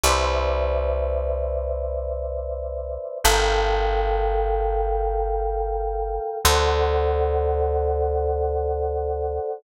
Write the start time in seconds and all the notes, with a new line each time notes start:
0.04 C2 B4 C5 D5 E5
3.24 G1 A4 A#4 F5 G5
6.45 D2 A4 C5 D5 F#5